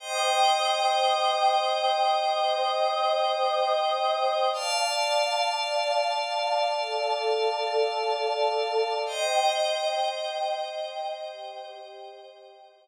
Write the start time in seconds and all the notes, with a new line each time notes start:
0.00 C5 D#5 G5 D#6
2.26 C5 D#5 D#6
4.53 D5 F5 A5
6.79 A4 D5 A5
9.06 C5 D#5 G5
11.31 G4 C5 G5